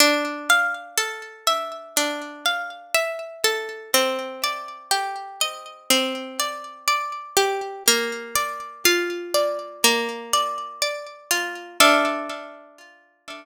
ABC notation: X:1
M:4/4
L:1/8
Q:1/4=61
K:Dm
V:1 name="Orchestral Harp"
D f A e D f e A | C d G _e C d d G | B, d F d B, d d F | [DAef]8 |]